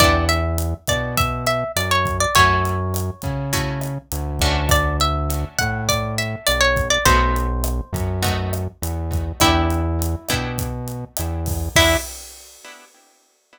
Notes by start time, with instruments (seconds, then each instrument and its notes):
0.00 synth bass 1 E2, acoustic guitar (steel) B3 D4 E4 G4 D5, kick, cross-stick, closed hi-hat
0.29 acoustic guitar (steel) E5, closed hi-hat
0.58 closed hi-hat
0.87 synth bass 1 B2, acoustic guitar (steel) D5, kick, cross-stick, closed hi-hat
1.17 acoustic guitar (steel) E5, kick, closed hi-hat
1.46 acoustic guitar (steel) E5, closed hi-hat
1.76 synth bass 1 F#2, acoustic guitar (steel) D5, cross-stick, closed hi-hat
1.91 acoustic guitar (steel) C#5
2.06 kick, closed hi-hat
2.20 acoustic guitar (steel) D5
2.35 synth bass 1 F#2, acoustic guitar (steel) A3 C#4 E4 F#4 C#5, kick, closed hi-hat
2.65 closed hi-hat
2.94 cross-stick, closed hi-hat
3.22 synth bass 1 C#3, kick, closed hi-hat
3.53 acoustic guitar (steel) A3 C#4 E4 F#4, kick, closed hi-hat
3.81 cross-stick, closed hi-hat
4.12 synth bass 1 D2, closed hi-hat
4.39 synth bass 1 D2, acoustic guitar (steel) A3 C#4 D4 F#4, kick, closed hi-hat
4.69 acoustic guitar (steel) D5, kick, cross-stick, closed hi-hat
5.00 acoustic guitar (steel) E5, closed hi-hat
5.30 closed hi-hat
5.59 synth bass 1 A2, acoustic guitar (steel) F#5, kick, cross-stick, closed hi-hat
5.89 acoustic guitar (steel) D5, kick, closed hi-hat
6.18 acoustic guitar (steel) E5, closed hi-hat
6.47 synth bass 1 B1, acoustic guitar (steel) D5, cross-stick, closed hi-hat
6.61 acoustic guitar (steel) C#5
6.76 kick, closed hi-hat
6.90 acoustic guitar (steel) D5
7.05 synth bass 1 B1, acoustic guitar (steel) A3 B3 D#4 F#4 C5, kick, closed hi-hat
7.36 closed hi-hat
7.64 cross-stick, closed hi-hat
7.93 synth bass 1 F#2, kick, closed hi-hat
8.22 acoustic guitar (steel) A3 B3 D#4 F#4, kick, closed hi-hat
8.53 cross-stick, closed hi-hat
8.82 synth bass 1 E2, closed hi-hat
9.12 kick, closed hi-hat
9.40 synth bass 1 E2, acoustic guitar (steel) B3 D4 E4 G4, kick, cross-stick, closed hi-hat
9.70 closed hi-hat
10.02 closed hi-hat
10.29 synth bass 1 B2, acoustic guitar (steel) B3 D4 E4 G4, kick, cross-stick, closed hi-hat
10.58 kick, closed hi-hat
10.88 closed hi-hat
11.17 synth bass 1 E2, cross-stick, closed hi-hat
11.46 kick, open hi-hat
11.75 synth bass 1 E2, acoustic guitar (steel) B3 D4 E4 G4, kick, crash